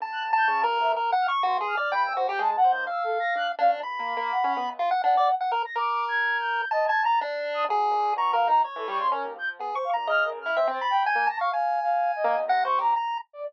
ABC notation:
X:1
M:4/4
L:1/16
Q:1/4=125
K:none
V:1 name="Acoustic Grand Piano"
D,4 (3_D,2 G,,2 =D,,2 z4 G,,2 z2 | (3G,,2 _E,,2 F,,2 (3_A,2 B,,2 E,,2 z4 D z _D =D,, | (3_D,,2 _B,2 B,2 z _D =B, D,, z8 | z16 |
_G,2 _B,,2 =B,,4 z E, =G, _D, _D _E,, F,2 | B, z2 _B,, _D,4 C C z2 _A,, _B, z2 | z6 _B, E,, C,4 z4 |]
V:2 name="Ocarina"
z _g' z =g' (3_d'2 _B2 e2 z2 f' z c'2 f'2 | b e' c g' (3a2 _g2 =g'2 (3e'2 A2 _b'2 _g' z f z | z4 _g2 z4 g3 z2 _b' | (3d'4 _a'4 g'4 (3_e2 a'2 =a'2 z3 _e' |
z4 (3_d'2 f2 _b2 z A d' c' _B2 g' z | z c f z (3f'2 _B2 f'2 (3c2 a'2 g2 g'2 _b' _d' | (3f4 f4 _e4 (3_b'2 _d'2 _b2 z3 =d |]
V:3 name="Lead 1 (square)"
(3a4 a4 _B4 (3B2 _g2 _d'2 (3_G2 _A2 =d2 | g2 _G =G _A z c2 f6 D2 | b8 F _g D d z g _B z | _B8 (3a2 a2 _b2 D4 |
_A4 (3_b2 _B2 _E2 _d4 z4 | (3_A2 _d'2 _b2 _e2 z =E =e z =b2 _a2 =a f | _a8 (3_g2 c2 =G2 _b2 z2 |]